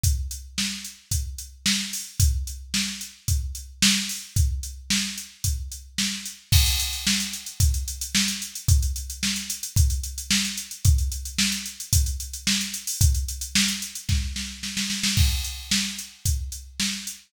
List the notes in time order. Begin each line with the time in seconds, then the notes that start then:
0.03 kick, closed hi-hat
0.31 closed hi-hat
0.58 snare
0.84 closed hi-hat
1.11 kick, closed hi-hat
1.38 closed hi-hat
1.66 snare
1.93 open hi-hat
2.20 kick, closed hi-hat
2.47 closed hi-hat
2.74 snare
3.01 closed hi-hat
3.28 kick, closed hi-hat
3.55 closed hi-hat
3.82 snare
4.09 open hi-hat
4.36 kick, closed hi-hat
4.63 closed hi-hat
4.90 snare
5.18 closed hi-hat
5.44 kick, closed hi-hat
5.72 closed hi-hat
5.98 snare
6.26 closed hi-hat
6.52 kick, crash
6.66 closed hi-hat
6.80 closed hi-hat
6.93 closed hi-hat
7.07 snare
7.20 closed hi-hat
7.33 closed hi-hat
7.46 closed hi-hat
7.60 kick, closed hi-hat
7.74 closed hi-hat
7.88 closed hi-hat
8.01 closed hi-hat
8.15 snare
8.28 closed hi-hat
8.42 closed hi-hat
8.55 closed hi-hat
8.68 kick, closed hi-hat
8.82 closed hi-hat
8.96 closed hi-hat
9.10 closed hi-hat
9.23 snare
9.36 closed hi-hat
9.50 closed hi-hat
9.63 closed hi-hat
9.76 kick, closed hi-hat
9.90 closed hi-hat
10.03 closed hi-hat
10.18 closed hi-hat
10.31 snare
10.45 closed hi-hat
10.58 closed hi-hat
10.71 closed hi-hat
10.85 kick, closed hi-hat
10.98 closed hi-hat
11.12 closed hi-hat
11.25 closed hi-hat
11.38 snare
11.52 closed hi-hat
11.66 closed hi-hat
11.80 closed hi-hat
11.93 kick, closed hi-hat
12.06 closed hi-hat
12.20 closed hi-hat
12.33 closed hi-hat
12.47 snare
12.61 closed hi-hat
12.74 closed hi-hat
12.87 open hi-hat
13.01 kick, closed hi-hat
13.15 closed hi-hat
13.28 closed hi-hat
13.41 closed hi-hat
13.55 snare
13.68 closed hi-hat
13.82 closed hi-hat
13.95 closed hi-hat
14.09 kick, snare
14.36 snare
14.63 snare
14.77 snare
14.90 snare
15.03 snare
15.17 kick, crash
15.44 closed hi-hat
15.71 snare
15.99 closed hi-hat
16.25 kick, closed hi-hat
16.52 closed hi-hat
16.80 snare
17.07 closed hi-hat